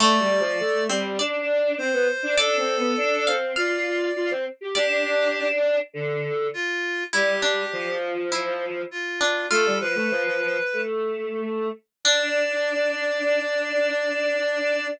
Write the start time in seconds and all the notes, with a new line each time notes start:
0.00 A3 D5
0.20 G3
0.40 F3
0.60 A3
0.89 G3 C4
1.19 D4 D5
1.78 C4 C5
1.93 B3
2.23 D4
2.37 D4 A4 D5
2.57 C4
2.77 B3
2.97 D4
3.27 C4 F5
3.56 F4 D5 F5
4.16 F4
4.31 C4
4.61 G4
4.75 D4 G4 D5
5.93 D3
6.54 F4
7.13 G3 E4 G4
7.42 D4
7.73 F3
8.32 E4
8.91 F4
9.21 D4
9.50 A3 F4 A4
9.65 G3
9.80 F3 B4
9.95 A3
10.11 F3
10.26 F3
10.42 F3
10.73 A3
12.04 D4 D5